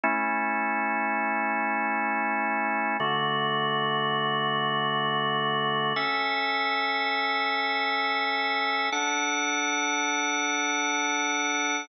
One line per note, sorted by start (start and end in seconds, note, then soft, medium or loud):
0.04 2.97 A3 medium
0.04 2.97 C#4 medium
0.04 2.97 E4 medium
3.00 5.93 D3 loud
3.00 5.93 A3 medium
3.00 5.93 F#4 medium
5.96 8.90 C#4 medium
5.96 8.90 A4 medium
5.96 8.90 E5 loud
8.92 11.86 D4 loud
8.92 11.86 A4 medium
8.92 11.86 F#5 loud